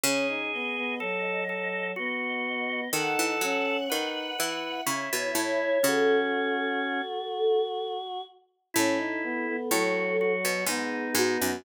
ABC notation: X:1
M:3/4
L:1/16
Q:1/4=62
K:E
V:1 name="Choir Aahs"
c2 d6 d4 | f8 c2 c c | A10 z2 | A8 G2 F F |]
V:2 name="Drawbar Organ"
G4 A2 A2 F4 | A4 B2 B2 E4 | C6 z6 | E4 F2 F2 D4 |]
V:3 name="Choir Aahs"
C D B, B, F,4 B,4 | D2 C2 D2 E2 E4 | F10 z2 | C D B, B, F,4 B,4 |]
V:4 name="Harpsichord" clef=bass
C,12 | D, E, F,2 D,2 E,2 C, B,, A,,2 | C,6 z6 | A,,4 A,,3 B,, G,,2 G,, F,, |]